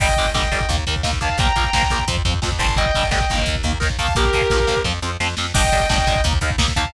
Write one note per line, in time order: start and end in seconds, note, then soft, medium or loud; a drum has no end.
0.00 0.15 G1 medium
0.00 0.05 D3 medium
0.00 0.05 G3 loud
0.00 0.30 D#5 medium
0.00 0.30 G5 medium
0.00 kick medium
0.00 crash medium
0.09 kick medium
0.17 0.33 G1 medium
0.17 0.25 D3 medium
0.17 0.25 G3 medium
0.17 kick medium
0.17 closed hi-hat soft
0.25 kick medium
0.34 0.49 G1 medium
0.34 0.41 D3 medium
0.34 0.41 G3 medium
0.34 0.68 D#5 medium
0.34 0.68 G5 medium
0.34 kick medium
0.34 snare medium
0.42 kick medium
0.52 0.66 G1 medium
0.52 0.58 D3 medium
0.52 0.58 G3 medium
0.52 kick medium
0.52 closed hi-hat medium
0.61 kick medium
0.69 0.84 D#2 loud
0.69 0.76 D#3 medium
0.69 0.76 A#3 medium
0.69 kick medium
0.69 closed hi-hat medium
0.78 kick medium
0.87 1.02 D#2 medium
0.87 0.94 D#3 medium
0.87 0.94 A#3 medium
0.87 kick medium
0.87 closed hi-hat medium
0.96 kick medium
1.03 1.19 D#2 medium
1.03 1.10 D#3 medium
1.03 1.10 A#3 medium
1.03 kick medium
1.03 snare medium
1.13 kick medium
1.21 1.37 D#2 medium
1.21 1.28 D#3 medium
1.21 1.28 A#3 medium
1.21 1.38 F5 medium
1.21 1.38 A5 medium
1.21 kick medium
1.21 closed hi-hat medium
1.29 kick medium
1.38 1.52 A#1 medium
1.38 1.46 F3 medium
1.38 1.46 A#3 loud
1.38 1.72 G5 medium
1.38 1.72 A#5 medium
1.38 kick medium
1.38 closed hi-hat medium
1.46 kick medium
1.56 1.70 A#1 medium
1.56 1.64 F3 medium
1.56 1.64 A#3 medium
1.56 kick medium
1.56 closed hi-hat medium
1.64 kick medium
1.73 1.88 A#1 medium
1.73 1.82 F3 medium
1.73 1.82 A#3 medium
1.73 2.04 G5 medium
1.73 2.04 A#5 medium
1.73 kick medium
1.73 snare loud
1.83 kick medium
1.90 2.05 A#1 medium
1.90 1.98 F3 medium
1.90 1.98 A#3 medium
1.90 kick medium
1.90 closed hi-hat medium
1.99 kick medium
2.08 2.22 F2 loud
2.08 2.15 F3 medium
2.08 2.15 C4 loud
2.08 kick medium
2.08 closed hi-hat medium
2.17 kick medium
2.25 2.40 F2 medium
2.25 2.32 F3 medium
2.25 2.32 C4 medium
2.25 kick medium
2.25 closed hi-hat medium
2.34 kick medium
2.42 2.59 F2 medium
2.42 2.49 F3 medium
2.42 2.49 C4 medium
2.42 kick medium
2.42 snare medium
2.52 kick medium
2.59 2.91 G1 loud
2.59 2.66 F3 medium
2.59 2.66 C4 medium
2.59 2.74 A5 medium
2.59 2.74 C6 medium
2.59 kick medium
2.59 closed hi-hat medium
2.69 kick medium
2.76 2.84 D3 medium
2.76 2.84 G3 loud
2.76 3.06 D#5 medium
2.76 3.06 G5 loud
2.76 kick medium
2.76 closed hi-hat medium
2.86 kick medium
2.95 3.10 G1 medium
2.95 3.02 D3 medium
2.95 3.02 G3 medium
2.95 kick medium
2.95 closed hi-hat medium
3.03 kick medium
3.11 3.26 G1 medium
3.11 3.18 D3 medium
3.11 3.18 G3 medium
3.11 3.40 D#5 medium
3.11 3.40 G5 medium
3.11 kick medium
3.11 snare medium
3.20 kick medium
3.30 3.45 G1 medium
3.30 3.55 D#3 loud
3.30 3.55 A#3 medium
3.30 kick medium
3.30 closed hi-hat medium
3.38 kick medium
3.46 3.63 D#2 medium
3.46 kick medium
3.46 closed hi-hat medium
3.56 kick medium
3.63 3.78 D#2 medium
3.63 3.71 D#3 medium
3.63 3.71 A#3 medium
3.63 kick medium
3.63 closed hi-hat medium
3.73 kick medium
3.80 3.97 D#2 medium
3.80 3.87 D#3 medium
3.80 3.87 A#3 medium
3.80 kick medium
3.80 snare medium
3.90 kick medium
3.99 4.13 D#2 medium
3.99 4.06 D#3 medium
3.99 4.06 A#3 medium
3.99 4.14 F5 medium
3.99 4.14 A5 medium
3.99 kick medium
3.99 open hi-hat medium
4.08 kick medium
4.15 4.30 A#1 medium
4.15 4.23 F3 loud
4.15 4.23 A#3 medium
4.15 4.80 G4 medium
4.15 4.80 A#4 loud
4.15 kick medium
4.15 closed hi-hat medium
4.25 kick medium
4.33 4.48 A#1 medium
4.33 4.41 F3 medium
4.33 4.41 A#3 medium
4.33 kick medium
4.33 closed hi-hat medium
4.41 kick medium
4.50 4.65 A#1 medium
4.50 4.58 F3 medium
4.50 4.58 A#3 medium
4.50 kick medium
4.50 snare medium
4.60 kick medium
4.67 4.83 A#1 medium
4.67 4.74 F3 medium
4.67 4.74 A#3 medium
4.67 kick medium
4.67 closed hi-hat medium
4.77 kick medium
4.84 5.00 F2 medium
4.84 4.91 F3 loud
4.84 4.91 C4 loud
4.84 kick medium
4.84 snare medium
5.02 5.17 F2 medium
5.02 5.09 F3 medium
5.02 5.09 C4 medium
5.20 5.35 F2 medium
5.20 5.27 F3 medium
5.20 5.27 C4 medium
5.20 snare medium
5.37 5.53 F2 medium
5.37 5.45 F3 medium
5.37 5.45 C4 medium
5.37 snare medium
5.54 5.70 G1 loud
5.54 5.61 G3 loud
5.54 5.61 D4 loud
5.54 5.88 D#5 loud
5.54 5.88 G5 loud
5.54 kick medium
5.54 crash loud
5.64 kick medium
5.72 5.87 G1 loud
5.72 5.80 G3 medium
5.72 5.80 D4 medium
5.72 kick medium
5.72 closed hi-hat medium
5.80 kick medium
5.89 6.05 G1 loud
5.89 5.96 G3 medium
5.89 5.96 D4 medium
5.89 6.21 D#5 medium
5.89 6.21 G5 medium
5.89 kick medium
5.89 snare loud
5.98 kick medium
6.07 6.22 G1 medium
6.07 6.14 G3 medium
6.07 6.14 D4 loud
6.07 kick medium
6.07 closed hi-hat medium
6.16 kick medium
6.24 6.39 D#2 loud
6.24 6.32 A#3 loud
6.24 6.32 D#4 loud
6.24 kick medium
6.24 closed hi-hat medium
6.33 kick medium
6.41 6.56 D#2 loud
6.41 6.49 A#3 medium
6.41 6.49 D#4 loud
6.41 kick medium
6.41 closed hi-hat medium
6.50 kick medium
6.58 6.73 D#2 loud
6.58 6.65 A#3 medium
6.58 6.65 D#4 loud
6.58 kick medium
6.58 snare loud
6.68 kick medium
6.76 6.91 D#2 loud
6.76 6.84 A#3 loud
6.76 6.84 D#4 loud
6.76 6.92 F5 medium
6.76 6.92 A5 loud
6.76 kick medium
6.76 closed hi-hat medium
6.85 kick medium